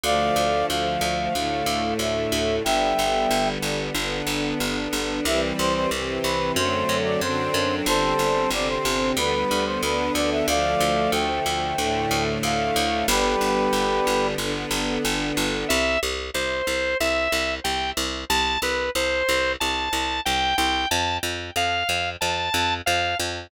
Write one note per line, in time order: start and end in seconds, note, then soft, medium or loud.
0.04 0.31 D2 medium
0.04 1.33 D3 medium
0.04 1.34 F3 medium
0.04 1.33 A3 medium
0.04 0.66 D5 medium
0.04 0.66 F5 loud
0.36 0.64 D2 medium
0.68 0.98 D2 medium
0.68 1.93 F5 medium
1.01 1.29 D2 medium
1.33 1.63 D2 medium
1.33 2.63 A2 medium
1.33 2.63 D3 medium
1.33 2.63 A3 medium
1.66 1.94 D2 medium
1.99 2.27 D2 medium
1.99 2.56 E5 medium
2.32 2.60 D2 medium
2.64 2.94 G1 medium
2.64 3.93 D3 medium
2.64 3.93 G3 medium
2.64 3.93 B3 medium
2.64 3.49 E5 medium
2.64 3.49 G5 loud
2.99 3.26 G1 medium
3.31 3.58 G1 medium
3.62 3.90 G1 medium
3.94 4.22 G1 medium
3.94 5.25 D3 medium
3.94 5.25 B3 medium
3.94 5.25 D4 medium
4.27 4.54 G1 medium
4.60 4.88 G1 medium
4.93 5.20 G1 medium
5.25 5.53 C2 medium
5.25 5.90 E3 medium
5.25 5.90 G3 medium
5.25 5.90 C4 medium
5.25 5.41 E5 loud
5.58 5.87 C2 medium
5.58 5.74 C5 loud
5.75 5.90 C5 medium
5.91 6.19 C2 medium
5.91 6.55 C3 medium
5.91 6.55 E3 medium
5.91 6.55 C4 medium
6.24 6.52 C2 medium
6.24 6.52 B4 medium
6.56 6.84 F#2 medium
6.56 7.21 D3 medium
6.56 7.21 F#3 medium
6.56 7.21 A3 medium
6.56 7.21 C4 medium
6.56 6.97 C5 medium
6.89 7.17 F#2 medium
7.05 7.20 D5 medium
7.21 7.49 F#2 medium
7.21 7.86 D3 medium
7.21 7.86 F#3 medium
7.21 7.86 C4 medium
7.21 7.86 D4 medium
7.21 7.75 C5 medium
7.54 7.82 F#2 medium
7.86 8.14 G1 medium
7.86 8.51 D3 medium
7.86 8.51 G3 medium
7.86 8.51 C4 medium
7.86 8.50 A4 medium
7.86 8.50 C5 loud
8.19 8.47 G1 medium
8.50 8.78 G1 medium
8.50 9.16 C3 medium
8.50 9.16 D3 medium
8.50 9.16 C4 medium
8.50 8.68 D5 medium
8.68 9.11 C5 medium
8.85 9.13 G1 medium
9.17 9.44 D2 medium
9.17 9.82 D3 medium
9.17 9.82 G3 medium
9.17 9.82 B3 medium
9.17 9.65 B4 medium
9.51 9.79 D2 medium
9.66 9.81 C5 medium
9.82 10.10 D2 medium
9.82 10.46 D3 medium
9.82 10.47 B3 medium
9.82 10.47 D4 medium
9.82 10.13 B4 medium
10.14 10.43 D2 medium
10.14 10.30 D5 medium
10.31 10.46 E5 medium
10.47 10.75 D2 medium
10.47 11.76 D3 medium
10.47 11.76 F3 medium
10.47 11.76 A3 medium
10.47 11.11 D5 medium
10.47 11.11 F5 loud
10.80 11.08 D2 medium
11.12 11.40 D2 medium
11.12 12.23 G5 medium
11.46 11.74 D2 medium
11.77 12.06 D2 medium
11.77 13.06 A2 medium
11.77 13.06 D3 medium
11.77 13.06 A3 medium
12.11 12.39 D2 medium
12.43 12.71 D2 medium
12.43 13.06 F5 medium
12.76 13.04 D2 medium
13.07 13.36 G1 loud
13.07 14.36 D3 medium
13.07 14.36 G3 medium
13.07 14.36 B3 medium
13.07 14.27 G4 medium
13.07 14.27 B4 loud
13.41 13.69 G1 medium
13.73 14.00 G1 medium
14.07 14.35 G1 medium
14.38 14.66 G1 medium
14.38 15.68 D3 medium
14.38 15.68 B3 medium
14.38 15.68 D4 medium
14.71 14.98 G1 medium
15.05 15.32 G1 medium
15.37 15.65 G1 medium
15.69 15.98 C2 medium
15.69 15.99 E5 medium
16.03 16.30 C2 medium
16.34 16.62 C2 medium
16.34 16.97 C5 medium
16.67 16.95 C2 medium
17.00 17.28 C2 medium
17.00 17.54 E5 medium
17.32 17.60 C2 medium
17.64 17.92 C2 medium
17.64 17.90 G5 medium
17.97 18.25 C2 medium
18.30 18.58 C2 medium
18.30 18.59 A5 medium
18.62 18.90 C2 medium
18.62 18.90 B4 medium
18.95 19.23 C2 medium
18.95 19.52 C5 medium
19.29 19.56 C2 medium
19.60 19.89 C2 medium
19.60 20.21 A5 medium
19.93 20.20 C2 medium
20.25 20.54 C2 medium
20.25 20.56 G5 medium
20.58 20.86 C2 medium
20.58 20.88 G5 medium
20.91 21.19 F2 medium
20.91 21.17 A5 medium
21.23 21.51 F2 medium
21.56 21.83 F2 medium
21.56 22.10 F5 medium
21.89 22.17 F2 medium
22.21 22.49 F2 medium
22.21 22.74 A5 medium
22.54 22.82 F2 medium
22.86 23.15 F2 medium
22.86 23.17 F5 medium
23.19 23.47 F2 medium